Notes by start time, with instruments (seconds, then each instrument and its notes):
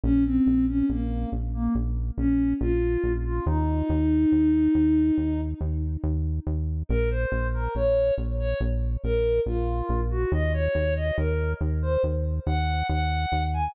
0.04 synth bass 1 A#1, ocarina C#4
0.25 ocarina C4
0.47 synth bass 1 A#1
0.68 ocarina C#4
0.89 synth bass 1 A#1, ocarina A#3
1.32 synth bass 1 A#1
1.54 ocarina A#3
1.75 synth bass 1 A#1
2.18 synth bass 1 A#1, ocarina C#4
2.61 synth bass 1 A#1, ocarina F4
3.04 synth bass 1 A#1
3.25 ocarina F4
3.46 synth bass 1 D#2, ocarina D#4
3.89 synth bass 1 D#2
4.32 synth bass 1 D#2
4.75 synth bass 1 D#2
5.18 synth bass 1 D#2
5.61 synth bass 1 D#2
6.04 synth bass 1 D#2
6.47 synth bass 1 D#2
6.89 synth bass 1 A#1, ocarina A#4
7.11 ocarina C5
7.32 synth bass 1 A#1
7.54 ocarina A#4
7.75 synth bass 1 A#1, ocarina C#5
8.18 synth bass 1 A#1
8.39 ocarina C#5
8.61 synth bass 1 A#1
9.04 synth bass 1 A#1, ocarina A#4
9.46 synth bass 1 A#1, ocarina F4
9.89 synth bass 1 A#1
10.11 ocarina F#4
10.32 synth bass 1 D#2, ocarina D#5
10.54 ocarina C#5
10.75 synth bass 1 D#2
10.96 ocarina D#5
11.18 synth bass 1 D#2, ocarina A#4
11.61 synth bass 1 D#2
11.82 ocarina C5
12.04 synth bass 1 D#2
12.46 synth bass 1 D#2, ocarina F#5
12.89 synth bass 1 D#2, ocarina F#5
13.32 synth bass 1 D#2
13.54 ocarina G#5